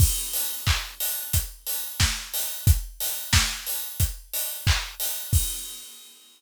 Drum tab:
CC |x-------|--------|x-------|
HH |-o-oxo-o|xo-oxo-o|--------|
CP |--x-----|------x-|--------|
SD |------o-|--o-----|--------|
BD |o-o-o-o-|o-o-o-o-|o-------|